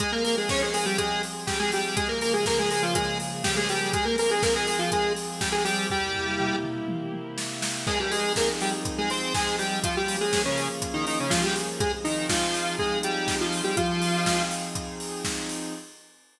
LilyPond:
<<
  \new Staff \with { instrumentName = "Lead 1 (square)" } { \time 4/4 \key f \minor \tempo 4 = 122 <aes aes'>16 <bes bes'>16 <bes bes'>16 <aes aes'>16 <des' des''>16 <aes aes'>16 <aes aes'>16 <g g'>16 <aes aes'>8 r8 <g g'>16 <aes aes'>16 <g g'>8 | <aes aes'>16 <bes bes'>16 <bes bes'>16 <aes aes'>16 <bes bes'>16 <aes aes'>16 <aes aes'>16 <f f'>16 <aes aes'>8 r8 <g g'>16 <aes aes'>16 <g g'>8 | <aes aes'>16 <bes bes'>16 <bes bes'>16 <aes aes'>16 <bes bes'>16 <aes aes'>16 <aes aes'>16 <f f'>16 <aes aes'>8 r8 <g g'>16 <aes aes'>16 <g g'>8 | <g g'>4. r2 r8 |
<aes aes'>16 <g g'>16 <aes aes'>8 <bes bes'>16 r16 <g g'>16 r8 <aes aes'>16 <c' c''>8 <aes aes'>8 <g g'>8 | <f f'>16 <g g'>8 <aes aes'>8 <des des'>8 r8 <ees ees'>16 <ees ees'>16 <des des'>16 <f f'>16 <g g'>16 r8 | <aes aes'>16 r16 <ees ees'>8 <f f'>4 <aes aes'>8 <g g'>8. <f f'>8 <g g'>16 | <f f'>4. r2 r8 | }
  \new Staff \with { instrumentName = "Pad 5 (bowed)" } { \time 4/4 \key f \minor <f c' aes'>1 | <des f bes aes'>1 | <f c' aes'>1 | <c bes e' g'>1 |
<f c' ees' aes'>1 | <f bes des' aes'>1 | <f c' ees' aes'>1 | <f c' ees' aes'>1 | }
  \new DrumStaff \with { instrumentName = "Drums" } \drummode { \time 4/4 <hh bd>8 hho8 <bd sn>8 hho8 <hh bd>8 hho8 <bd sn>8 hho8 | <hh bd>8 hho8 <bd sn>8 hho8 <hh bd>8 hho8 <bd sn>8 hho8 | <hh bd>8 hho8 <bd sn>8 hho8 <hh bd>8 hho8 <bd sn>8 hho8 | <bd tomfh>8 tomfh8 toml8 toml8 tommh8 tommh8 sn8 sn8 |
<cymc bd>8 hho8 <bd sn>8 hho8 <hh bd>8 hho8 <bd sn>8 hho8 | <hh bd>8 hho8 <bd sn>8 hho8 <hh bd>8 hho8 <bd sn>8 hho8 | <hh bd>8 hho8 <bd sn>8 hho8 bd8 hh8 <bd sn>8 hho8 | <hh bd>8 hho8 <bd sn>8 hho8 <hh bd>8 hho8 <bd sn>8 hho8 | }
>>